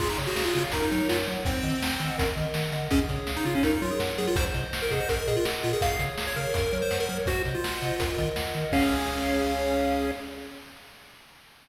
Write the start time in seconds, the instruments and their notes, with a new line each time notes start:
0.00 synth bass 1 C#2, lead 1 (square) F4 G#4, kick, crash
0.09 lead 1 (square) D#4
0.18 synth bass 1 C#3, lead 1 (square) C#5, closed hi-hat
0.27 lead 1 (square) F#4
0.36 synth bass 1 C#2, lead 1 (square) F#4 F5, snare
0.45 lead 1 (square) F4
0.55 synth bass 1 C#3, lead 1 (square) F4 C#5, closed hi-hat
0.72 synth bass 1 F#2, lead 1 (square) D#4 A#4, kick, closed hi-hat
0.82 lead 1 (square) D#4
0.91 synth bass 1 F#3, lead 1 (square) D#4 C#5, closed hi-hat
1.09 synth bass 1 F#2, lead 1 (square) F4 F#5, snare
1.27 synth bass 1 F#3, lead 1 (square) C#5, closed hi-hat
1.45 synth bass 1 D#2, lead 1 (square) C4 C5, kick, closed hi-hat
1.63 synth bass 1 D#3, lead 1 (square) D#5, closed hi-hat
1.82 synth bass 1 D#2, lead 1 (square) F#5, snare
1.99 synth bass 1 D#3, lead 1 (square) D#5, closed hi-hat
2.18 synth bass 1 D#2, lead 1 (square) A#4, kick, closed hi-hat
2.36 synth bass 1 D#3, lead 1 (square) D#5, closed hi-hat
2.54 synth bass 1 D#3, lead 1 (square) F#5, snare
2.72 synth bass 1 D3, lead 1 (square) D#5, closed hi-hat
2.91 synth bass 1 C#2, lead 1 (square) C#4 G#4, kick, closed hi-hat
3.09 synth bass 1 C#3, lead 1 (square) C#5, kick, closed hi-hat
3.27 synth bass 1 C#2, lead 1 (square) F5, snare
3.36 lead 1 (square) D#4
3.45 synth bass 1 C#3, lead 1 (square) F4 C#5, closed hi-hat
3.55 lead 1 (square) C#4
3.63 synth bass 1 F#2, lead 1 (square) D#4 A#4, kick, closed hi-hat
3.73 lead 1 (square) D#4
3.82 synth bass 1 F#3, lead 1 (square) F4 C#5, closed hi-hat
3.91 lead 1 (square) G#4
4.00 synth bass 1 F#2, lead 1 (square) F#5, snare
4.18 synth bass 1 F#3, lead 1 (square) G#4 C#5, closed hi-hat
4.27 lead 1 (square) F4
4.36 synth bass 1 C2, lead 1 (square) C5, kick, closed hi-hat
4.54 synth bass 1 C3, lead 1 (square) D#5, closed hi-hat
4.73 synth bass 1 C2, lead 1 (square) F#5, snare
4.82 lead 1 (square) A#4
4.90 synth bass 1 C3, lead 1 (square) G#4 D#5, kick, closed hi-hat
5.00 lead 1 (square) C5
5.09 synth bass 1 A#1, lead 1 (square) A#4, kick, closed hi-hat
5.18 lead 1 (square) A#4
5.27 synth bass 1 A#2, lead 1 (square) G#4 D#5, closed hi-hat
5.37 lead 1 (square) F4
5.45 synth bass 1 A#1, lead 1 (square) F#5, snare
5.63 synth bass 1 A#2, lead 1 (square) F4 D#5, closed hi-hat
5.73 lead 1 (square) G#4
5.81 synth bass 1 C#2, lead 1 (square) G#4 F5, kick, closed hi-hat
5.99 synth bass 1 C#3, lead 1 (square) C#5, closed hi-hat
6.18 synth bass 1 C#2, lead 1 (square) F5, snare
6.27 lead 1 (square) C#5
6.36 synth bass 1 C#3, lead 1 (square) A#4 C#5, closed hi-hat
6.54 synth bass 1 F#2, lead 1 (square) A#4, kick, closed hi-hat
6.72 synth bass 1 F#3, lead 1 (square) C#5, closed hi-hat
6.82 lead 1 (square) C5
6.91 synth bass 1 F#2, lead 1 (square) F#5, snare
7.00 lead 1 (square) A#4
7.09 synth bass 1 F#3, lead 1 (square) A#4 C#5, closed hi-hat
7.26 synth bass 1 C2, lead 1 (square) F#4 C5, kick, closed hi-hat
7.45 synth bass 1 C3, lead 1 (square) D#5, closed hi-hat
7.55 lead 1 (square) F4
7.64 synth bass 1 C2, lead 1 (square) F#5, snare
7.82 synth bass 1 C3, lead 1 (square) D#5, closed hi-hat
7.99 synth bass 1 D#2, lead 1 (square) A#4, kick, closed hi-hat
8.17 synth bass 1 D#3, lead 1 (square) D#5, kick, closed hi-hat
8.36 synth bass 1 D#2, lead 1 (square) F#5, snare
8.54 synth bass 1 D#3, lead 1 (square) D#5, closed hi-hat
8.72 synth bass 1 C#2, lead 1 (square) C#4 G#4 C#5 F5, kick, crash